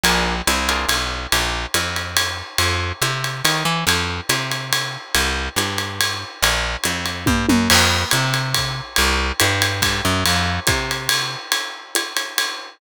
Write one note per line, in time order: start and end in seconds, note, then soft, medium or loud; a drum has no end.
0.03 0.42 A#1 medium
0.03 0.35 D4 medium
0.03 0.35 F4 medium
0.03 0.35 G#4 loud
0.03 0.35 A#4 medium
0.03 ride medium
0.47 0.86 C2 medium
0.47 hi-hat pedal medium
0.47 ride medium
0.69 0.98 D4 medium
0.69 0.98 F4 medium
0.69 0.98 G#4 medium
0.69 0.98 A#4 medium
0.69 ride medium
0.88 1.27 B1 medium
0.88 ride medium
1.32 1.66 A#1 medium
1.32 ride medium
1.74 2.42 F2 medium
1.74 hi-hat pedal medium
1.74 ride medium
1.96 ride medium
2.17 ride medium
2.58 2.92 F2 medium
2.58 ride medium
3.02 3.42 C3 medium
3.02 hi-hat pedal medium
3.02 ride medium
3.24 ride medium
3.45 3.64 D#3 medium
3.45 ride medium
3.65 3.84 E3 medium
3.87 4.21 F2 medium
3.87 ride medium
4.29 4.97 C3 medium
4.29 hi-hat pedal medium
4.29 ride medium
4.51 ride medium
4.73 ride medium
5.14 5.49 C2 medium
5.14 ride medium
5.56 6.24 G2 medium
5.56 hi-hat pedal medium
5.56 ride medium
5.78 ride medium
6.01 ride medium
6.42 6.77 A#1 medium
6.42 ride medium
6.84 7.25 F2 medium
6.84 hi-hat pedal medium
6.84 ride medium
7.05 ride medium
7.26 7.46 G2 medium
7.26 kick medium
7.26 high tom medium
7.49 7.68 F#2 medium
7.49 high tom medium
7.70 8.05 F2 medium
7.70 crash medium
7.70 ride medium
8.11 8.81 C3 medium
8.11 hi-hat pedal medium
8.11 ride medium
8.34 ride medium
8.54 kick soft
8.54 ride medium
8.96 9.32 C2 loud
8.96 ride medium
9.40 9.81 G2 medium
9.40 hi-hat pedal medium
9.40 ride medium
9.62 ride medium
9.82 10.01 G2 medium
9.82 kick soft
9.82 ride medium
10.05 10.24 F#2 medium
10.26 10.60 F2 medium
10.26 ride medium
10.67 11.36 C3 medium
10.67 kick medium
10.67 hi-hat pedal medium
10.67 ride medium
10.91 ride medium
11.09 ride loud
11.52 ride medium
11.95 hi-hat pedal medium
11.95 ride medium
12.16 ride medium
12.38 ride medium